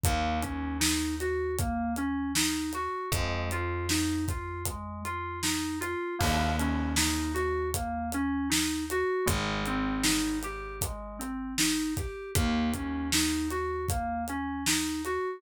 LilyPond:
<<
  \new Staff \with { instrumentName = "Electric Piano 2" } { \time 4/4 \key ees \dorian \tempo 4 = 78 bes8 des'8 ees'8 ges'8 bes8 des'8 ees'8 ges'8 | aes8 f'8 ees'8 f'8 aes8 f'8 ees'8 f'8 | bes8 des'8 ees'8 ges'8 bes8 des'8 ees'8 ges'8 | aes8 c'8 ees'8 g'8 aes8 c'8 ees'8 g'8 |
bes8 des'8 ees'8 ges'8 bes8 des'8 ees'8 ges'8 | }
  \new Staff \with { instrumentName = "Electric Bass (finger)" } { \clef bass \time 4/4 \key ees \dorian ees,1 | f,1 | ees,1 | aes,,1 |
ees,1 | }
  \new DrumStaff \with { instrumentName = "Drums" } \drummode { \time 4/4 <hh bd>8 <hh bd>8 sn8 hh8 <hh bd>8 hh8 sn8 hh8 | <hh bd>8 hh8 sn8 <hh bd>8 <hh bd>8 hh8 sn8 hh8 | <cymc bd>8 hh8 sn8 hh8 <hh bd>8 hh8 sn8 hh8 | <hh bd>8 hh8 sn8 hh8 <hh bd>8 hh8 sn8 <hh bd>8 |
<hh bd>8 <hh bd>8 sn8 hh8 <hh bd>8 hh8 sn8 hh8 | }
>>